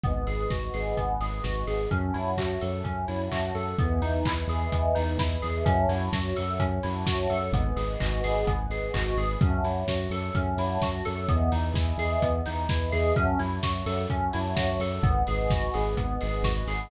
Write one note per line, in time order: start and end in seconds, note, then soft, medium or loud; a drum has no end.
0.04 0.25 G#1 medium
0.04 0.25 B3 medium
0.04 1.89 B4 medium
0.04 1.89 D#5 medium
0.04 1.89 F#5 medium
0.04 1.89 G#5 medium
0.04 kick loud
0.04 closed hi-hat loud
0.27 0.47 G#1 medium
0.27 0.48 G#4 medium
0.27 open hi-hat medium
0.49 0.69 G#1 medium
0.49 0.72 F#4 medium
0.49 kick loud
0.49 snare medium
0.74 0.94 G#1 medium
0.74 0.95 G#4 medium
0.74 open hi-hat medium
0.97 1.18 G#1 medium
0.97 1.18 B3 medium
0.97 kick medium
0.97 closed hi-hat loud
1.21 1.40 G#1 medium
1.21 1.42 G#4 medium
1.21 open hi-hat medium
1.44 1.64 G#1 medium
1.44 1.65 F#4 medium
1.44 kick medium
1.44 snare loud
1.67 1.87 G#1 medium
1.67 1.88 G#4 medium
1.67 open hi-hat medium
1.91 2.11 F#2 medium
1.91 2.12 C#4 medium
1.91 3.77 C#5 medium
1.91 3.77 E5 medium
1.91 3.77 F#5 medium
1.91 3.77 A5 medium
1.91 kick loud
1.91 closed hi-hat loud
2.14 2.35 F#2 medium
2.14 2.35 E4 medium
2.14 open hi-hat medium
2.37 2.57 F#2 medium
2.37 2.59 F#4 medium
2.37 kick medium
2.37 clap loud
2.61 2.82 F#2 medium
2.61 2.82 A4 medium
2.61 open hi-hat medium
2.84 3.05 F#2 medium
2.84 3.05 C#4 medium
2.84 kick medium
2.84 closed hi-hat loud
3.08 3.29 F#2 medium
3.08 3.29 E4 medium
3.08 open hi-hat medium
3.32 3.51 F#2 medium
3.32 3.53 F#4 medium
3.32 kick medium
3.32 clap loud
3.55 3.75 F#2 medium
3.55 3.76 A4 medium
3.55 open hi-hat medium
3.79 4.00 E2 medium
3.79 4.00 B3 medium
3.79 5.65 B4 medium
3.79 5.65 D#5 medium
3.79 5.65 E5 medium
3.79 5.65 G#5 medium
3.79 kick loud
3.79 closed hi-hat loud
4.02 4.22 E2 medium
4.02 4.23 D#4 medium
4.02 open hi-hat medium
4.25 4.45 E2 medium
4.25 4.47 E4 medium
4.25 kick loud
4.25 clap loud
4.47 4.67 E2 medium
4.47 4.70 G#4 medium
4.47 open hi-hat medium
4.72 4.93 E2 medium
4.72 4.94 B3 medium
4.72 kick loud
4.72 closed hi-hat loud
4.95 5.17 E2 medium
4.95 5.16 D#4 medium
4.95 open hi-hat loud
5.18 5.38 E2 medium
5.18 5.40 E4 medium
5.18 kick loud
5.18 snare loud
5.42 5.63 E2 medium
5.42 5.63 G#4 medium
5.42 open hi-hat medium
5.65 5.86 F#2 loud
5.65 5.87 C#4 medium
5.65 7.52 C#5 medium
5.65 7.52 E5 medium
5.65 7.52 F#5 medium
5.65 7.52 A5 medium
5.65 kick loud
5.65 closed hi-hat loud
5.89 6.09 F#2 medium
5.89 6.10 E4 medium
5.89 open hi-hat loud
6.13 6.33 F#2 medium
6.13 6.34 F#4 medium
6.13 kick loud
6.13 snare loud
6.36 6.58 F#2 medium
6.36 6.57 A4 medium
6.36 open hi-hat loud
6.59 6.79 F#2 medium
6.59 6.81 C#4 medium
6.59 kick loud
6.59 closed hi-hat loud
6.83 7.04 F#2 medium
6.83 7.04 E4 medium
6.83 open hi-hat loud
7.06 7.27 F#2 medium
7.06 7.27 F#4 medium
7.06 kick loud
7.06 snare loud
7.30 7.50 F#2 medium
7.30 7.51 A4 medium
7.30 open hi-hat medium
7.52 7.72 G#1 loud
7.52 7.75 B3 medium
7.52 9.40 B4 medium
7.52 9.40 D#5 medium
7.52 9.40 F#5 medium
7.52 9.40 G#5 medium
7.52 kick loud
7.52 closed hi-hat loud
7.76 7.96 G#1 medium
7.76 7.97 G#4 medium
7.76 open hi-hat loud
8.00 8.22 G#1 medium
8.00 8.21 F#4 medium
8.00 kick loud
8.00 clap loud
8.24 8.44 G#1 medium
8.24 8.45 G#4 medium
8.24 open hi-hat loud
8.47 8.67 G#1 medium
8.47 8.68 B3 medium
8.47 kick loud
8.47 closed hi-hat loud
8.69 8.89 G#1 medium
8.69 8.92 G#4 medium
8.69 open hi-hat medium
8.94 9.14 G#1 medium
8.94 9.15 F#4 medium
8.94 kick loud
8.94 clap loud
9.16 9.36 G#1 medium
9.16 9.39 G#4 medium
9.16 open hi-hat medium
9.41 9.61 F#2 medium
9.41 9.63 C#4 medium
9.41 11.27 C#5 medium
9.41 11.27 E5 medium
9.41 11.27 F#5 medium
9.41 11.27 A5 medium
9.41 kick loud
9.41 closed hi-hat loud
9.63 9.83 F#2 medium
9.63 9.86 E4 medium
9.63 open hi-hat medium
9.87 10.07 F#2 medium
9.87 10.10 F#4 medium
9.87 kick medium
9.87 snare loud
10.10 10.30 F#2 medium
10.10 10.33 A4 medium
10.10 open hi-hat medium
10.35 10.55 F#2 medium
10.35 10.56 C#4 medium
10.35 kick loud
10.35 closed hi-hat loud
10.58 10.78 F#2 medium
10.58 10.80 E4 medium
10.58 open hi-hat loud
10.82 11.02 F#2 medium
10.82 11.04 F#4 medium
10.82 kick loud
10.82 snare loud
11.05 11.27 F#2 medium
11.05 11.26 A4 medium
11.05 open hi-hat medium
11.28 11.50 E2 loud
11.28 11.50 B3 medium
11.28 13.14 B4 medium
11.28 13.14 D#5 medium
11.28 13.14 E5 medium
11.28 13.14 G#5 medium
11.28 kick loud
11.28 closed hi-hat loud
11.52 11.72 E2 medium
11.52 11.73 D#4 medium
11.52 open hi-hat loud
11.74 11.93 E2 medium
11.74 11.96 E4 medium
11.74 kick loud
11.74 snare loud
11.97 12.17 E2 medium
11.97 12.20 G#4 medium
11.97 open hi-hat loud
12.22 12.42 E2 medium
12.22 12.43 B3 medium
12.22 kick loud
12.22 closed hi-hat loud
12.46 12.67 E2 medium
12.46 12.67 D#4 medium
12.46 open hi-hat loud
12.69 12.90 E2 medium
12.69 12.90 E4 medium
12.69 kick loud
12.69 snare loud
12.92 13.12 E2 medium
12.92 13.13 G#4 medium
12.92 open hi-hat loud
13.16 13.35 F#2 medium
13.16 13.37 C#4 loud
13.16 15.03 C#5 medium
13.16 15.03 E5 medium
13.16 15.03 F#5 medium
13.16 15.03 A5 medium
13.16 kick loud
13.16 closed hi-hat loud
13.39 13.60 F#2 medium
13.39 13.60 E4 medium
13.39 open hi-hat medium
13.63 13.83 F#2 medium
13.63 13.84 F#4 medium
13.63 kick loud
13.63 snare loud
13.86 14.06 F#2 medium
13.86 14.07 A4 medium
13.86 open hi-hat loud
14.09 14.29 F#2 medium
14.09 14.31 C#4 medium
14.09 kick loud
14.09 closed hi-hat loud
14.33 14.54 F#2 medium
14.33 14.54 E4 medium
14.33 open hi-hat loud
14.56 14.78 F#2 medium
14.56 14.77 F#4 medium
14.56 kick loud
14.56 snare loud
14.79 14.99 F#2 medium
14.79 15.02 A4 medium
14.79 open hi-hat loud
15.03 15.23 G#1 medium
15.03 15.24 B3 medium
15.03 16.89 B4 medium
15.03 16.89 D#5 medium
15.03 16.89 F#5 medium
15.03 16.89 G#5 medium
15.03 kick loud
15.03 closed hi-hat loud
15.27 15.48 G#1 medium
15.27 15.49 G#4 medium
15.27 open hi-hat medium
15.49 15.69 G#1 medium
15.49 15.72 F#4 medium
15.49 kick loud
15.49 snare loud
15.74 15.95 G#1 medium
15.74 15.95 G#4 medium
15.74 open hi-hat loud
15.97 16.17 G#1 medium
15.97 16.18 B3 medium
15.97 kick loud
15.97 closed hi-hat loud
16.21 16.42 G#1 medium
16.21 16.42 G#4 medium
16.21 open hi-hat loud
16.43 16.63 G#1 medium
16.43 16.65 F#4 medium
16.43 kick loud
16.43 snare loud
16.67 16.87 G#1 medium
16.67 16.89 G#4 medium
16.67 open hi-hat loud